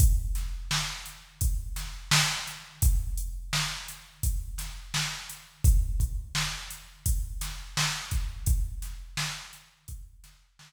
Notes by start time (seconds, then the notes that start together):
0.00 kick, closed hi-hat
0.35 snare, closed hi-hat
0.71 snare
1.06 closed hi-hat
1.41 kick, closed hi-hat
1.76 snare, closed hi-hat
2.11 snare
2.47 closed hi-hat
2.82 kick, closed hi-hat
3.17 closed hi-hat
3.53 snare
3.88 closed hi-hat
4.23 kick, closed hi-hat
4.58 snare, closed hi-hat
4.94 snare
5.30 closed hi-hat
5.64 kick, closed hi-hat
6.00 kick, closed hi-hat
6.35 snare
6.70 closed hi-hat
7.06 kick, closed hi-hat
7.41 snare, closed hi-hat
7.77 snare
8.11 kick, closed hi-hat
8.46 kick, closed hi-hat
8.82 snare, closed hi-hat
9.17 snare
9.53 closed hi-hat
9.88 kick, closed hi-hat
10.24 snare, closed hi-hat
10.59 snare